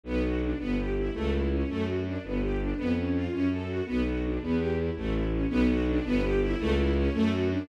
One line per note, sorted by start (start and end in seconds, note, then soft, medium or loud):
0.03 0.54 B1 loud
0.03 0.22 B3 loud
0.24 0.40 F#4 medium
0.42 0.58 D4 medium
0.59 1.10 G1 medium
0.59 0.75 B3 loud
0.78 0.94 G4 medium
0.98 1.14 E4 medium
1.13 1.64 C#2 loud
1.13 1.30 A3 loud
1.32 1.48 E4 medium
1.52 1.68 C#4 medium
1.68 2.18 F#2 medium
1.68 1.85 A3 loud
1.86 2.03 F#4 medium
2.06 2.22 D4 medium
2.23 2.73 G1 loud
2.23 2.40 B3 medium
2.41 2.58 G4 medium
2.59 2.76 D4 medium
2.77 3.28 F2 medium
2.77 2.93 B3 loud
2.97 3.13 C#4 medium
3.14 3.30 F4 medium
3.32 3.82 F#2 medium
3.32 3.48 C#4 loud
3.51 3.68 A4 medium
3.67 3.84 F#4 medium
3.86 4.38 B1 loud
3.86 4.03 B3 loud
4.06 4.22 F#4 medium
4.24 4.41 D4 medium
4.40 4.91 E2 loud
4.40 4.58 B3 loud
4.58 4.74 G4 medium
4.78 4.94 E4 medium
4.96 5.46 A1 loud
4.96 5.13 A3 medium
5.13 5.29 E4 medium
5.31 5.48 C#4 medium
5.50 6.00 B1 loud
5.50 5.66 B3 loud
5.68 5.85 F#4 loud
5.88 6.04 D4 loud
6.05 6.55 G1 loud
6.05 6.21 B3 loud
6.24 6.40 G4 loud
6.41 6.58 E4 loud
6.59 7.09 C#2 loud
6.59 6.75 A3 loud
6.77 6.93 E4 loud
6.96 7.13 C#4 loud
7.13 7.63 F#2 loud
7.13 7.30 A3 loud
7.31 7.47 F#4 loud
7.52 7.68 D4 loud